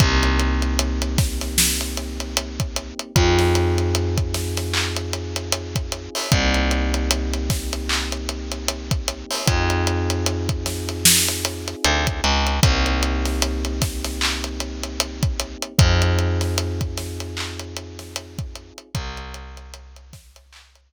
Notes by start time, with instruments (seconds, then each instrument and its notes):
0.00 electric bass (finger) C2, electric piano 1 A#3 C4 D#4 G4, kick, closed hi-hat
0.23 closed hi-hat
0.39 closed hi-hat
0.62 closed hi-hat
0.79 closed hi-hat
1.02 closed hi-hat
1.18 kick, snare, closed hi-hat
1.41 snare, closed hi-hat
1.58 snare
1.81 closed hi-hat
1.97 closed hi-hat
2.20 closed hi-hat
2.37 closed hi-hat
2.60 kick, closed hi-hat
2.76 closed hi-hat
2.99 closed hi-hat
3.16 electric bass (finger) F2, electric piano 1 C4 D#4 F4 G#4, kick, closed hi-hat
3.39 snare, closed hi-hat
3.55 closed hi-hat
3.78 closed hi-hat
3.95 closed hi-hat
4.17 kick, closed hi-hat
4.34 snare, closed hi-hat
4.57 snare, closed hi-hat
4.74 clap
4.96 closed hi-hat
5.13 closed hi-hat
5.36 closed hi-hat
5.52 closed hi-hat
5.75 kick, closed hi-hat
5.92 closed hi-hat
6.15 open hi-hat
6.31 electric bass (finger) C2, electric piano 1 A#3 C4 D#4 G4, kick, closed hi-hat
6.54 closed hi-hat
6.71 closed hi-hat
6.94 closed hi-hat
7.11 closed hi-hat
7.33 closed hi-hat
7.50 kick, snare, closed hi-hat
7.73 closed hi-hat
7.89 clap
8.12 closed hi-hat
8.29 closed hi-hat
8.51 closed hi-hat
8.68 closed hi-hat
8.91 kick, closed hi-hat
9.08 closed hi-hat
9.31 open hi-hat
9.46 electric bass (finger) F2, electric piano 1 C4 D#4 F4 G#4, kick, closed hi-hat
9.70 closed hi-hat
9.87 closed hi-hat
10.10 closed hi-hat
10.26 closed hi-hat
10.49 kick, closed hi-hat
10.66 snare, closed hi-hat
10.89 closed hi-hat
11.05 snare
11.28 closed hi-hat
11.45 closed hi-hat
11.68 closed hi-hat
11.84 electric bass (finger) D2, closed hi-hat
12.07 kick, closed hi-hat
12.24 electric bass (finger) C#2, closed hi-hat
12.47 closed hi-hat
12.63 electric bass (finger) C2, electric piano 1 A#3 C4 D#4 G4, kick, closed hi-hat
12.86 closed hi-hat
13.03 closed hi-hat
13.25 snare, closed hi-hat
13.42 closed hi-hat
13.65 closed hi-hat
13.82 kick, snare, closed hi-hat
14.04 snare, closed hi-hat
14.21 clap
14.44 closed hi-hat
14.60 closed hi-hat
14.83 closed hi-hat
15.00 closed hi-hat
15.23 kick, closed hi-hat
15.40 closed hi-hat
15.62 closed hi-hat
15.78 electric bass (finger) F2, electric piano 1 C4 D#4 F4 G#4, kick, closed hi-hat
16.02 closed hi-hat
16.19 closed hi-hat
16.41 snare, closed hi-hat
16.58 closed hi-hat
16.81 kick, closed hi-hat
16.97 snare, closed hi-hat
17.20 closed hi-hat
17.37 clap
17.59 closed hi-hat
17.76 closed hi-hat
17.99 snare, closed hi-hat
18.16 closed hi-hat
18.39 kick, closed hi-hat
18.55 closed hi-hat
18.78 closed hi-hat
18.95 electric bass (finger) C2, kick, closed hi-hat
19.17 closed hi-hat
19.34 closed hi-hat
19.57 closed hi-hat
19.74 closed hi-hat
19.96 closed hi-hat
20.13 kick, snare, closed hi-hat
20.36 closed hi-hat
20.53 clap
20.75 closed hi-hat